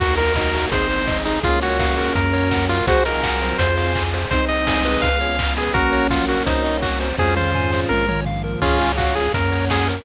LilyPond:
<<
  \new Staff \with { instrumentName = "Lead 1 (square)" } { \time 4/4 \key bes \minor \tempo 4 = 167 ges'8 bes'4. c''4. ees'8 | f'8 ges'4. bes'4. f'8 | ges'8 bes'4. c''4. r8 | c''8 ees''4. f''4. aes'8 |
<ges' bes'>4 f'8 ges'8 ees'4 ges'8 r8 | aes'8 c''4. bes'4 r4 | <des' f'>4 ges'8 aes'8 bes'4 aes'8 r8 | }
  \new Staff \with { instrumentName = "Lead 1 (square)" } { \time 4/4 \key bes \minor <ges' bes'>4 <ees' ges'>4 <c' ees'>2 | <bes des'>1 | <aes' c''>8 <f' aes'>4. <f' aes'>2 | <c' ees'>2~ <c' ees'>8 r4. |
<bes des'>1 | <des' f'>2~ <des' f'>8 r4. | <f' aes'>4 <des' f'>4 <bes des'>2 | }
  \new Staff \with { instrumentName = "Lead 1 (square)" } { \time 4/4 \key bes \minor ges'8 bes'8 ees''8 ges'8 aes'8 c''8 ees''8 aes'8 | aes'8 des''8 f''8 bes'4 des''8 ges''8 bes'8 | c''8 ees''8 ges''8 c''8 c''8 f''8 aes''8 c''8 | c''8 ees''8 aes''8 ces''4 des''8 f''8 aes''8 |
bes'8 des''8 ges''8 bes'8 c''8 ees''8 ges''8 c''8 | c''8 f''8 aes''8 c''8 bes'8 des''8 f''8 bes'8 | aes'8 des''8 f''8 aes'8 bes'8 des''8 ges''8 bes'8 | }
  \new Staff \with { instrumentName = "Synth Bass 1" } { \clef bass \time 4/4 \key bes \minor ees,2 aes,,2 | des,2 ges,2 | c,2 f,2 | c,2 des,2 |
bes,,2 c,2 | f,2 bes,,2 | des,2 ges,2 | }
  \new Staff \with { instrumentName = "Pad 2 (warm)" } { \time 4/4 \key bes \minor <bes ees' ges'>4 <bes ges' bes'>4 <aes c' ees'>4 <aes ees' aes'>4 | <aes des' f'>4 <aes f' aes'>4 <bes des' ges'>4 <ges bes ges'>4 | <c' ees' ges'>4 <ges c' ges'>4 <c' f' aes'>4 <c' aes' c''>4 | <c' ees' aes'>4 <aes c' aes'>4 <ces' des' f' aes'>4 <ces' des' aes' ces''>4 |
<bes des' ges'>4 <ges bes ges'>4 <c' ees' ges'>4 <ges c' ges'>4 | <c' f' aes'>4 <c' aes' c''>4 <bes des' f'>4 <f bes f'>4 | <aes' des'' f''>4 <aes' f'' aes''>4 <bes' des'' ges''>4 <ges' bes' ges''>4 | }
  \new DrumStaff \with { instrumentName = "Drums" } \drummode { \time 4/4 <cymc bd>8 hho8 <bd sn>8 hho8 <hh bd>8 hho8 <bd sn>8 hho8 | <hh bd>8 hho8 <bd sn>8 hho8 <hh bd>8 hho8 <bd sn>8 hho8 | <hh bd>8 hho8 <hc bd>8 hho8 <hh bd>8 hho8 <hc bd>8 hho8 | <hh bd>8 hho8 <bd sn>8 hho8 <hh bd>8 hho8 <hc bd>8 hho8 |
<hh bd>8 hho8 <bd sn>8 hho8 <hh bd>8 hho8 <hc bd>8 hho8 | <bd tommh>8 toml8 tomfh8 sn8 tommh8 toml8 tomfh4 | <cymc bd>8 hho8 <hc bd>8 hho8 <hh bd>8 hho8 <bd sn>8 hho8 | }
>>